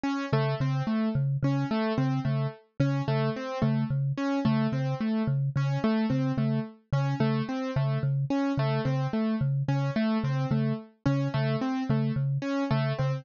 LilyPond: <<
  \new Staff \with { instrumentName = "Marimba" } { \clef bass \time 4/4 \tempo 4 = 109 r8 des8 des8 r8 des8 des8 r8 des8 | des8 r8 des8 des8 r8 des8 des8 r8 | des8 des8 r8 des8 des8 r8 des8 des8 | r8 des8 des8 r8 des8 des8 r8 des8 |
des8 r8 des8 des8 r8 des8 des8 r8 | des8 des8 r8 des8 des8 r8 des8 des8 | }
  \new Staff \with { instrumentName = "Acoustic Grand Piano" } { \time 4/4 des'8 a8 c'8 a8 r8 des'8 a8 c'8 | a8 r8 des'8 a8 c'8 a8 r8 des'8 | a8 c'8 a8 r8 des'8 a8 c'8 a8 | r8 des'8 a8 c'8 a8 r8 des'8 a8 |
c'8 a8 r8 des'8 a8 c'8 a8 r8 | des'8 a8 c'8 a8 r8 des'8 a8 c'8 | }
>>